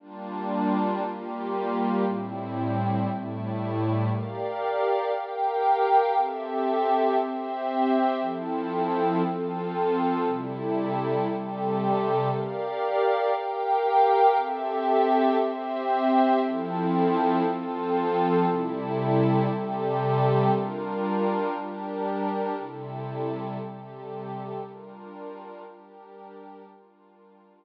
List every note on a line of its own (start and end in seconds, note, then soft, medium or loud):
0.00 1.01 G3 medium
0.00 1.01 A#3 medium
0.00 1.01 D4 medium
0.00 1.01 F4 medium
1.03 2.04 G3 medium
1.03 2.04 A#3 medium
1.03 2.04 F4 medium
1.03 2.04 G4 medium
2.05 3.07 A2 medium
2.05 3.07 G3 medium
2.05 3.07 C4 medium
2.05 3.07 E4 medium
3.08 4.09 A2 medium
3.08 4.09 G3 medium
3.08 4.09 A3 medium
3.08 4.09 E4 medium
4.10 5.12 G4 medium
4.10 5.12 A#4 medium
4.10 5.12 D5 medium
4.10 5.12 F5 medium
5.13 6.14 G4 medium
5.13 6.14 A#4 medium
5.13 6.14 F5 medium
5.13 6.14 G5 medium
6.15 7.17 C4 medium
6.15 7.17 G4 medium
6.15 7.17 A4 medium
6.15 7.17 E5 medium
7.18 8.20 C4 medium
7.18 8.20 G4 medium
7.18 8.20 C5 medium
7.18 8.20 E5 medium
8.21 9.22 F3 medium
8.21 9.22 C4 medium
8.21 9.22 E4 medium
8.21 9.22 A4 medium
9.23 10.25 F3 medium
9.23 10.25 C4 medium
9.23 10.25 F4 medium
9.23 10.25 A4 medium
10.26 11.27 C3 medium
10.26 11.27 G3 medium
10.26 11.27 E4 medium
10.26 11.27 A4 medium
11.28 12.30 C3 medium
11.28 12.30 G3 medium
11.28 12.30 G4 medium
11.28 12.30 A4 medium
12.31 13.32 G4 medium
12.31 13.32 A#4 medium
12.31 13.32 D5 medium
12.31 13.32 F5 loud
13.33 14.35 G4 medium
13.33 14.35 A#4 medium
13.33 14.35 F5 medium
13.33 14.35 G5 loud
14.36 15.37 C4 medium
14.36 15.37 G4 loud
14.36 15.37 A4 medium
14.36 15.37 E5 loud
15.38 16.40 C4 loud
15.38 16.40 G4 medium
15.38 16.40 C5 medium
15.38 16.40 E5 loud
16.41 17.43 F3 loud
16.41 17.43 C4 medium
16.41 17.43 E4 medium
16.41 17.43 A4 medium
17.44 18.45 F3 medium
17.44 18.45 C4 medium
17.44 18.45 F4 medium
17.44 18.45 A4 loud
18.46 19.48 C3 medium
18.46 19.48 G3 medium
18.46 19.48 E4 loud
18.46 19.48 A4 medium
19.49 20.50 C3 loud
19.49 20.50 G3 medium
19.49 20.50 G4 medium
19.49 20.50 A4 medium
20.51 21.53 G3 medium
20.51 21.53 D4 medium
20.51 21.53 F4 medium
20.51 21.53 A#4 medium
21.54 22.55 G3 medium
21.54 22.55 D4 loud
21.54 22.55 G4 medium
21.54 22.55 A#4 medium
22.56 23.58 C3 loud
22.56 23.58 G3 medium
22.56 23.58 E4 medium
22.56 23.58 A4 medium
23.59 24.60 C3 medium
23.59 24.60 G3 medium
23.59 24.60 G4 medium
23.59 24.60 A4 medium
24.62 25.63 G3 medium
24.62 25.63 D4 medium
24.62 25.63 F4 medium
24.62 25.63 A#4 medium
25.64 26.66 G3 medium
25.64 26.66 D4 medium
25.64 26.66 G4 medium
25.64 26.66 A#4 medium
26.67 27.65 G3 medium
26.67 27.65 D4 medium
26.67 27.65 F4 medium
26.67 27.65 A#4 medium